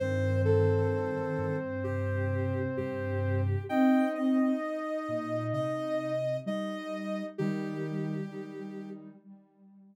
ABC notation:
X:1
M:4/4
L:1/8
Q:1/4=65
K:Cdor
V:1 name="Ocarina"
c A3 G2 G2 | g e3 e2 e2 | G4 z4 |]
V:2 name="Ocarina"
[Cc]8 | [Ee]6 [Ee]2 | [E,E]2 [E,E]2 z4 |]
V:3 name="Ocarina"
E,4 C,4 | C2 z6 | G,4 G,2 z2 |]
V:4 name="Ocarina" clef=bass
G,,3 G,,3 G,,2 | z3 B,, C,2 G,2 | E,2 z6 |]